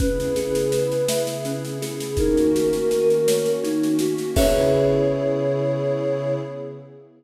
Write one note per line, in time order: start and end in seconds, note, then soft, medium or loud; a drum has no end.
0.00 2.16 C#3 medium
0.00 2.16 B3 medium
0.00 0.33 C#4 loud
0.00 2.16 E4 medium
0.00 2.16 G#4 medium
0.00 1.21 B4 loud
0.00 kick loud
0.00 snare medium
0.20 snare medium
0.36 0.69 G#4 medium
0.36 snare medium
0.55 snare medium
0.72 1.05 B4 medium
0.72 snare medium
0.92 snare medium
1.08 1.42 E5 medium
1.08 snare loud
1.27 snare medium
1.45 1.78 C#4 medium
1.45 snare medium
1.65 snare medium
1.82 2.15 G#4 medium
1.82 snare medium
2.00 snare medium
2.17 4.34 D#3 medium
2.17 4.34 A#3 medium
2.17 4.34 C#4 medium
2.17 2.51 D#4 medium
2.17 4.34 F#4 medium
2.17 3.51 A#4 loud
2.17 kick medium
2.17 snare medium
2.37 snare medium
2.55 2.88 F#4 medium
2.55 snare medium
2.73 snare medium
2.91 3.24 A#4 medium
2.91 snare medium
3.10 snare medium
3.28 3.60 C#5 medium
3.28 snare loud
3.46 snare medium
3.64 3.97 D#4 medium
3.64 snare medium
3.83 snare medium
3.99 4.33 F#4 medium
3.99 snare medium
4.18 snare medium
4.36 6.34 C#3 loud
4.36 6.34 B3 loud
4.36 6.35 C#4 loud
4.36 6.34 E4 loud
4.36 6.34 G#4 loud
4.36 6.35 G#4 medium
4.36 6.35 B4 loud
4.36 6.34 C#5 loud
4.36 6.35 E5 loud
4.36 kick loud
4.36 crash loud